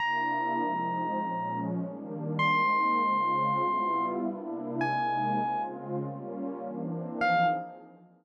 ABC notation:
X:1
M:4/4
L:1/8
Q:"Swing" 1/4=100
K:Fm
V:1 name="Electric Piano 1"
b6 z2 | c'6 z2 | a3 z5 | f2 z6 |]
V:2 name="Pad 2 (warm)"
[C,B,=D=E]2 [F,A,C_E]2 [B,,F,A,_D]2 [E,G,B,=D]2 | [A,B,CE]2 [D,A,CF]2 [G,=B,=EF]2 [C,_B,=DE]2 | [C,A,B,E]2 [D,A,CF]2 [G,B,DF]2 [=E,B,C=D]2 | [F,CEA]2 z6 |]